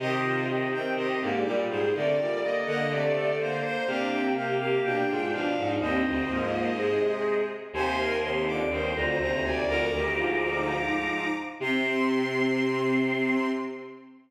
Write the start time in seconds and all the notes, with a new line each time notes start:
0.00 C3 D#3 C4 G4 C5 D#5
0.24 F4
0.48 D#3 C4 D#5
0.72 D#3 C4 G5
0.95 C3 G4 D#5
1.21 G#2 D3 A#3 D5
1.45 A#2 G3 D5
1.69 G#2 G#4 C5
1.94 C3 D3 A3 A#4 D5
2.18 A#2 G3
2.42 D3 A#3 D5 D#5
2.66 D3 A#3 D#5 F#5
2.90 C3 A3 D5
3.13 D3 A4
3.39 D3 A#3 C5 D5
3.63 C5
3.87 C3 A#3 D4 G4 F5
4.11 C4 G5
4.36 A#3 G4 F5
4.60 A#3 G4 F5
4.84 B2 D4 G5
5.08 G#2 G#3 F4
5.32 B2 F3 D4 F5
5.57 G#2 D#4
5.79 D#2 G2 D#3 C4 C5 D#5
6.05 D2 C4
6.29 G#2 F3 A#3
6.77 C3 G#3 G#4
7.73 D#2 C3 C5 G#5 C6
7.98 A#4
8.23 D#2 C3 C6
8.47 F2 D3 D6
8.69 D#2 G2 D#3 C5 C6
8.95 D2 F2 D3 A#5
9.18 D2 D#2 C3 A#5
9.44 D2 D5 G#5
9.67 D2 F2 D3 A#4 A#5 D6
9.92 D2 G2 D#3 G4
10.16 G#2 F3 F4
10.40 D#4
11.60 C3 C4 C6